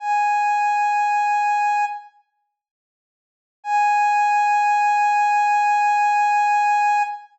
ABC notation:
X:1
M:4/4
L:1/8
Q:1/4=66
K:G#m
V:1 name="Ocarina"
g5 z3 | g8 |]